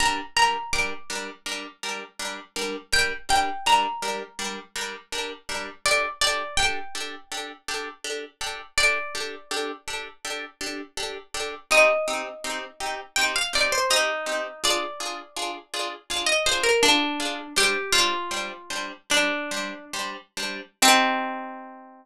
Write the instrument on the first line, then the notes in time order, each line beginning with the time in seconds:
orchestral harp
0.00 G3 D4 A#4 A#5
0.37 G3 D4 A#4 A#5
0.73 G3 D4 A#4 D6
1.10 G3 D4 A#4
1.46 G3 D4 A#4
1.83 G3 D4 A#4
2.19 G3 D4 A#4
2.56 G3 D4 A#4
2.93 G3 D4 A#4 G5
3.29 G3 D4 A#4 G5
3.66 G3 D4 A#4 A#5
4.02 G3 D4 A#4
4.39 G3 D4 A#4
4.76 G3 D4 A#4
5.12 G3 D4 A#4
5.49 G3 D4 A#4
5.86 D4 G4 A4 D5
6.21 D4 G4 A4 D5
6.57 D4 G4 A4 G5
6.95 D4 G4 A4
7.32 D4 G4 A4
7.68 D4 G4 A4
8.04 D4 G4 A4
8.41 D4 G4 A4
8.78 D4 G4 A4 D5
9.15 D4 G4 A4
9.51 D4 G4 A4
9.88 D4 G4 A4
10.25 D4 G4 A4
10.61 D4 G4 A4
10.97 D4 G4 A4
11.34 D4 G4 A4
11.71 C4 D#4 G4 D#5
12.08 C4 D#4 G4
12.44 C4 D#4 G4
12.80 C4 D#4 G4
13.16 C4 D#4 G4 G5
13.36 F5
13.53 C4 D#4 G4 D5
13.72 C5
13.90 C4 D#4 G4
14.26 C4 D#4 G4
14.64 D4 F4 G#4 D5
15.00 D4 F4 G#4
15.36 D4 F4 G#4
15.74 D4 F4 G#4
16.10 D4 F4 G#4 F5
16.27 D#5
16.46 D4 F4 G#4 C5
16.63 A#4
16.83 D4 F4 G#4
17.20 D4 F4 G#4
17.56 G3 D4 G4 C5
17.93 G3 D4 F4 C5
18.31 G3 D4 C5
18.70 G3 D4 C5
19.10 G3 D4 C5
19.51 G3 D4 C5
19.93 G3 D4 C5
20.37 G3 D4 C5
20.82 C4 D#4 G4